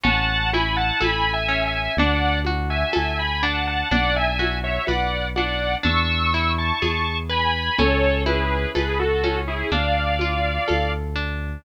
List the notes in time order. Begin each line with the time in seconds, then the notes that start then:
0.03 A1 C#4 F#5 A5, low conga
0.53 E4 G#5 B5, high conga
0.77 F#5 A5
1.01 A1 A4 G#5 B5, tambourine, high conga
1.33 E5 G#5
1.48 C#4
1.66 E5 G#5
1.97 D2 D4 D5 F#5, low conga
2.45 F#4, high conga
2.70 E5 G#5
2.93 D2 A4 E5 G#5, tambourine, high conga
3.19 G#5 B5
3.43 D4 F#5 A5
3.67 F#5 A5
3.91 B1 D4 D5 F#5, low conga
4.16 E5 G#5
4.39 F#4, high conga
4.64 C#5 E5
4.87 B1 B4 D5 F#5, tambourine, high conga
5.36 D4 D5 F#5, high conga
5.83 E2 D4 C#6 E6, low conga
6.34 E4
6.58 A5 C#6
6.82 E2 G#4, tambourine, high conga
7.29 B4 G#5 B5
7.78 C#2 C#4 A4 C#5, low conga
8.26 E4 G#4 B4, high conga
8.75 C#2 G#4 A4 B4, tambourine, high conga
8.99 F#4 A4
9.24 C#4, high conga
9.48 E4 G#4
9.71 D2 D4 D5 F5, low conga
10.19 F4, high conga
10.68 D2 A4, tambourine, high conga
11.16 D4